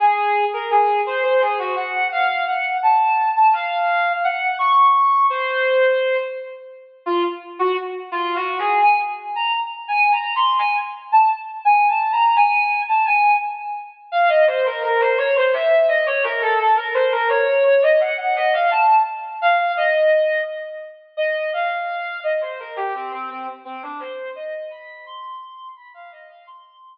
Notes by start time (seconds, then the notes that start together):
0.00 G#4
0.53 A#4
0.71 G#4
1.06 C5
1.23 C5
1.41 G#4
1.59 F#4
1.76 F#5
2.12 F5
2.48 F#5
2.83 A5
3.36 A5
3.53 F5
4.24 F#5
4.59 C#6
5.30 C5
7.06 F4
7.59 F#4
8.12 F4
8.35 F#4
8.59 G#4
8.82 G#5
9.36 A#5
9.88 G#5
10.12 A#5
10.36 C6
10.59 G#5
11.12 A5
11.65 G#5
11.89 A5
12.12 A#5
12.36 G#5
12.88 A5
13.05 G#5
14.12 F5
14.29 D#5
14.47 C5
14.65 A#4
14.83 A#4
15.00 C5
15.18 C#5
15.36 C5
15.53 E5
15.88 D#5
16.06 C#5
16.23 A#4
16.41 A4
16.59 A4
16.76 A#4
16.94 C5
17.12 A#4
17.29 C#5
17.64 C#5
17.82 D#5
18.00 F#5
18.17 F#5
18.36 D#5
18.53 F5
18.71 A5
19.41 F5
19.77 D#5
21.17 D#5
21.53 F5
22.23 D#5
22.41 C5
22.59 A#4
22.76 G4
22.94 C4
23.11 C4
23.30 C4
23.65 C4
23.82 D4
24.00 C5
24.35 D#5
24.71 B5
25.06 C6
25.76 B5
25.94 F5
26.11 D#5
26.30 F5
26.47 C6